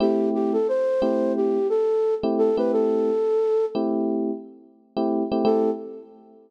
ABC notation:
X:1
M:4/4
L:1/16
Q:"Swing 16ths" 1/4=88
K:Am
V:1 name="Flute"
G2 G A c4 G2 A3 z A B | A6 z10 | A4 z12 |]
V:2 name="Electric Piano 1"
[A,CEG]6 [A,CEG]7 [A,CEG]2 [A,CEG]- | [A,CEG]6 [A,CEG]7 [A,CEG]2 [A,CEG] | [A,CEG]4 z12 |]